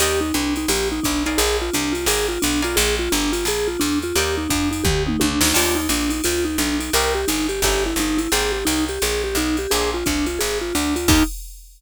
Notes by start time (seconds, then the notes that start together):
0.00 D#2 G4 A#4 D5 D#5 G5, ride
0.21 D#4
0.34 C2 D4, hi-hat pedal, ride
0.56 D#4, ride
0.68 A#1 G4, ride
0.92 D#4
1.03 B1 D4, kick, hi-hat pedal, ride
1.26 D#4 A#4 D5 F5 G#5, ride
1.38 A#1 G#4, ride
1.62 F4
1.73 C2 D4, hi-hat pedal, ride
1.92 F4, ride
2.06 G#1 G#4 A#4 D5 F5 G#5, ride
2.28 F4
2.42 B1 D4, hi-hat pedal, ride
2.62 F4 A#4 D5 F5 G#5, ride
2.76 A#1 G#4, ride
2.99 F4
3.12 G1 D4, hi-hat pedal, ride
3.33 F4, ride
3.45 A#1 G#4, ride
3.68 F4
3.80 E2 D4, hi-hat pedal, ride
4.02 F4, ride
4.16 D#2 G4 A#4 D5 D#5 G5, ride
4.38 D#4
4.50 F2 D4, kick, hi-hat pedal, ride
4.71 D#4, ride
4.84 D2 G4, kick, floor tom
5.07 D#4, mid tom
5.20 C#2 D4, high tom
5.41 D2 D#4, snare
5.54 D#2 D4 D#4 F4 G4, crash, ride
5.75 D#4
5.89 A#1 D4, hi-hat pedal, ride
6.09 D#4, ride
6.24 D2 F4, ride
6.45 D#4
6.58 B1 D4, hi-hat pedal, ride
6.80 D#4, ride
6.93 C2 C4 D#4 G4 A#4, ride
7.15 G4
7.28 G1 D#4, hi-hat pedal, ride
7.49 G4, ride
7.62 G1 C#4 D#4 E4 G4, kick, ride
7.86 E4
7.96 G1 D#4, hi-hat pedal, ride
8.18 E4, ride
8.32 G#1 A#3 C4 G4 G#4, ride
8.52 G4
8.65 C2 D#4, hi-hat pedal, ride
8.88 G4, ride
9.02 A#1 G#4, ride
9.24 G4
9.35 B1 D#4, hi-hat pedal, ride
9.57 G4, ride
9.71 A#1 A#3 C4 D4 G#4, ride
9.94 F4
10.06 C2 D4, kick, hi-hat pedal, ride
10.26 F4, ride
10.39 G#1 G#4, ride
10.61 F4
10.75 D2 D4, hi-hat pedal, ride
10.96 F4, ride
11.08 D#2 D4 D#4 F4 G4, kick, crash